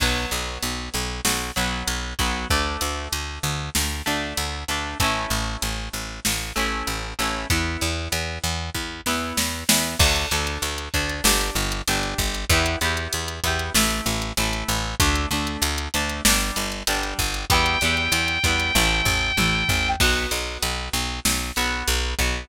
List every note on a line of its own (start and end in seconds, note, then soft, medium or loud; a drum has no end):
0.00 0.26 B1 medium
0.00 1.45 F#3 medium
0.00 1.45 B3 medium
0.00 kick loud
0.00 crash loud
0.31 0.58 B1 medium
0.31 closed hi-hat medium
0.62 0.89 B1 medium
0.62 closed hi-hat loud
0.94 1.21 B1 medium
0.94 closed hi-hat medium
1.25 1.51 B1 medium
1.25 snare loud
1.56 1.83 B1 medium
1.56 2.14 F#3 medium
1.56 2.14 B3 medium
1.56 closed hi-hat medium
1.87 2.14 B1 medium
1.87 closed hi-hat loud
2.19 2.46 B1 medium
2.19 2.47 F#3 medium
2.19 2.47 B3 medium
2.19 kick loud
2.19 closed hi-hat medium
2.50 2.77 D2 medium
2.50 3.94 A3 medium
2.50 3.94 D4 medium
2.50 kick loud
2.81 3.08 D2 medium
2.81 closed hi-hat loud
3.12 3.39 D2 medium
3.12 closed hi-hat loud
3.43 3.70 D2 medium
3.43 closed hi-hat medium
3.75 4.02 D2 medium
3.75 snare loud
4.06 4.34 D2 medium
4.06 4.63 A3 medium
4.06 4.63 D4 medium
4.06 closed hi-hat medium
4.37 4.64 D2 medium
4.37 closed hi-hat loud
4.68 4.95 D2 medium
4.68 4.98 A3 medium
4.68 4.98 D4 medium
4.68 closed hi-hat medium
5.00 5.26 A1 medium
5.00 6.44 A3 medium
5.00 6.44 C#4 medium
5.00 kick loud
5.00 closed hi-hat loud
5.04 6.44 E4 medium
5.30 5.57 A1 medium
5.30 closed hi-hat medium
5.62 5.89 A1 medium
5.62 closed hi-hat loud
5.93 6.20 A1 medium
5.93 closed hi-hat medium
6.25 6.52 A1 medium
6.25 snare loud
6.56 6.83 A1 medium
6.56 7.13 A3 medium
6.56 7.13 C#4 medium
6.56 7.13 E4 medium
6.56 closed hi-hat medium
6.87 7.14 A1 medium
6.87 closed hi-hat loud
7.18 7.46 A1 medium
7.18 7.47 A3 medium
7.18 7.47 C#4 medium
7.18 7.47 E4 medium
7.18 closed hi-hat medium
7.50 7.77 E2 medium
7.50 8.94 B3 medium
7.50 8.94 E4 medium
7.50 kick loud
7.50 closed hi-hat loud
7.81 8.08 E2 medium
7.81 closed hi-hat medium
8.12 8.39 E2 medium
8.12 closed hi-hat loud
8.43 8.70 E2 medium
8.43 closed hi-hat medium
8.74 9.01 E2 medium
8.74 kick medium
9.06 9.33 E2 medium
9.06 9.64 B3 medium
9.06 9.64 E4 medium
9.06 snare medium
9.37 9.64 E2 medium
9.37 snare loud
9.68 9.95 E2 medium
9.68 9.97 B3 medium
9.68 9.97 E4 medium
9.68 snare loud
9.99 10.26 D2 loud
9.99 10.28 D4 medium
9.99 10.28 A4 medium
9.99 kick loud
9.99 crash loud
10.16 closed hi-hat medium
10.31 10.58 D2 medium
10.31 10.89 D4 medium
10.31 10.89 A4 medium
10.31 closed hi-hat medium
10.47 closed hi-hat medium
10.62 10.89 D2 medium
10.62 closed hi-hat loud
10.78 closed hi-hat medium
10.94 11.21 D2 medium
10.94 11.23 D4 medium
10.94 11.23 A4 medium
10.94 kick loud
10.94 closed hi-hat medium
11.09 closed hi-hat medium
11.24 11.51 G1 medium
11.24 11.82 D4 medium
11.24 11.82 G4 medium
11.24 snare loud
11.41 closed hi-hat medium
11.55 11.82 G1 medium
11.55 closed hi-hat medium
11.72 closed hi-hat loud
11.88 12.14 G1 medium
11.88 12.45 D4 medium
11.88 12.45 G4 medium
11.88 closed hi-hat loud
12.03 closed hi-hat medium
12.18 12.45 G1 medium
12.18 kick loud
12.18 closed hi-hat loud
12.35 closed hi-hat medium
12.49 12.76 E2 loud
12.49 12.79 B3 medium
12.49 12.79 E4 medium
12.49 12.79 G4 medium
12.49 kick loud
12.49 closed hi-hat loud
12.66 closed hi-hat loud
12.81 13.08 E2 medium
12.81 13.39 B3 medium
12.81 13.39 E4 medium
12.81 13.39 G4 medium
12.81 closed hi-hat medium
12.97 closed hi-hat medium
13.13 13.40 E2 medium
13.13 closed hi-hat loud
13.28 closed hi-hat medium
13.44 13.70 E2 medium
13.44 13.72 B3 medium
13.44 13.72 E4 medium
13.44 13.72 G4 medium
13.44 kick medium
13.44 closed hi-hat loud
13.59 closed hi-hat medium
13.74 14.01 A1 medium
13.74 14.33 A3 medium
13.74 14.33 E4 loud
13.74 snare loud
13.90 closed hi-hat medium
14.06 14.32 A1 medium
14.06 closed hi-hat loud
14.22 closed hi-hat medium
14.37 14.64 A1 medium
14.37 14.95 A3 medium
14.37 14.95 E4 medium
14.37 closed hi-hat loud
14.53 closed hi-hat medium
14.68 14.95 A1 medium
14.68 closed hi-hat medium
15.00 15.26 D2 medium
15.00 15.29 A3 medium
15.00 15.29 D4 medium
15.00 kick loud
15.00 closed hi-hat loud
15.15 closed hi-hat medium
15.31 15.57 D2 medium
15.31 15.89 A3 medium
15.31 15.89 D4 medium
15.31 closed hi-hat medium
15.47 closed hi-hat medium
15.62 15.88 D2 medium
15.62 closed hi-hat loud
15.78 closed hi-hat loud
15.94 16.21 D2 medium
15.94 16.23 A3 medium
15.94 16.23 D4 medium
15.94 closed hi-hat loud
16.10 closed hi-hat medium
16.25 16.51 G1 medium
16.25 16.82 G3 medium
16.25 16.82 D4 medium
16.25 snare loud
16.41 closed hi-hat medium
16.56 16.83 G1 medium
16.56 closed hi-hat loud
16.72 closed hi-hat medium
16.87 17.14 G1 medium
16.87 17.45 G3 medium
16.87 17.45 D4 medium
16.87 closed hi-hat loud
17.03 closed hi-hat medium
17.19 17.45 G1 medium
17.19 kick loud
17.19 closed hi-hat medium
17.34 closed hi-hat medium
17.50 17.77 E2 medium
17.50 17.78 G3 medium
17.50 17.78 B3 medium
17.50 17.78 E4 medium
17.50 19.88 G5 medium
17.50 kick loud
17.50 closed hi-hat loud
17.66 closed hi-hat medium
17.81 18.08 E2 medium
17.81 18.39 G3 medium
17.81 18.39 B3 medium
17.81 closed hi-hat medium
17.85 18.39 E4 medium
17.97 closed hi-hat medium
18.12 18.38 E2 medium
18.12 closed hi-hat loud
18.28 closed hi-hat medium
18.43 18.71 E2 medium
18.43 18.72 G3 medium
18.43 18.72 B3 medium
18.43 18.72 E4 medium
18.43 kick loud
18.43 closed hi-hat loud
18.60 closed hi-hat medium
18.75 19.02 A1 loud
18.75 19.32 A3 medium
18.75 19.32 E4 medium
18.75 kick medium
18.75 high tom loud
19.05 19.32 A1 medium
19.05 floor tom loud
19.37 19.64 A1 medium
19.37 19.94 A3 medium
19.37 19.94 E4 medium
19.37 high tom loud
19.69 19.96 A1 medium
19.69 floor tom loud
20.00 20.27 B1 medium
20.00 21.45 B3 loud
20.00 21.45 F#4 medium
20.00 kick loud
20.00 crash loud
20.31 20.58 B1 medium
20.31 closed hi-hat loud
20.62 20.89 B1 medium
20.62 closed hi-hat loud
20.93 21.20 B1 medium
20.93 closed hi-hat medium
21.25 21.52 B1 medium
21.25 snare loud
21.56 21.83 B1 medium
21.56 22.14 B3 medium
21.56 22.14 F#4 medium
21.56 closed hi-hat medium
21.88 22.14 B1 medium
21.88 closed hi-hat loud
22.19 22.45 B1 medium
22.19 22.48 B3 medium
22.19 22.48 F#4 medium
22.19 kick medium
22.19 closed hi-hat medium